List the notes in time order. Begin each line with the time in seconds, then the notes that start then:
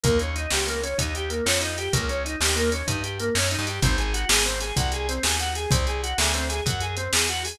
0.03 D#2 A#3, kick, closed hi-hat
0.19 C#4, closed hi-hat
0.36 D#4, closed hi-hat
0.51 C#2 G4, snare
0.67 A#3, closed hi-hat
0.83 C#4, closed hi-hat
0.98 D#2 D#4, kick, closed hi-hat
1.15 G4, closed hi-hat
1.30 A#3, closed hi-hat
1.46 F2 C#4, snare
1.61 D#4, closed hi-hat
1.78 G4, closed hi-hat
1.93 C#2 A#3, kick, closed hi-hat
2.09 C#4, closed hi-hat
2.25 D#4, closed hi-hat
2.40 D#2 G4, snare
2.56 A#3, closed hi-hat
2.72 C#4, closed hi-hat
2.87 G2 D#4, kick, closed hi-hat
3.04 G4, closed hi-hat
3.19 A#3, closed hi-hat
3.35 F#2 C#4, snare
3.51 D#4, closed hi-hat
3.59 G2
3.67 G4, closed hi-hat
3.82 G#1 C4, kick, closed hi-hat
3.98 G#4, closed hi-hat
4.14 F#4, closed hi-hat
4.29 G#1 G#4, snare
4.46 C4, closed hi-hat
4.60 G#4, closed hi-hat
4.76 C2 F#4, kick, closed hi-hat
4.92 G#4, closed hi-hat
5.09 C4, closed hi-hat
5.23 D#2 G#4, snare
5.39 F#4, closed hi-hat
5.55 G#4, closed hi-hat
5.71 C2 C4, kick, closed hi-hat
5.87 G#4, closed hi-hat
6.03 F#4, closed hi-hat
6.18 D2 G#4, snare
6.34 C4, closed hi-hat
6.49 G#4, closed hi-hat
6.66 F#2 F#4, kick, closed hi-hat
6.81 G#4, closed hi-hat
6.97 C4, closed hi-hat
7.13 E2 G#4, snare
7.29 F#4, closed hi-hat
7.45 G#4, open hi-hat